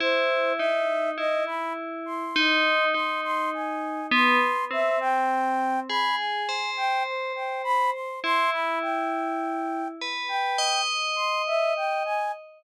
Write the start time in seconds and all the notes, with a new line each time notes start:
0.00 E4 C5
0.57 D#4 E5
1.18 E4 D#5
1.47 B5
2.06 C6
2.36 D#4
2.94 D#4 C6
3.24 C6
3.54 G#5
4.12 B3 C6
4.71 C4 E5
5.00 G5
5.89 G#4 B5
6.17 G#5
6.49 C5
6.77 G5
7.06 C5
7.36 G5
7.64 B5
7.93 C6
8.24 E4 C6
8.52 B5
8.82 G5
10.01 B4
10.28 G5
10.58 D#5
11.16 C6
11.47 E5
11.76 G5
12.05 G#5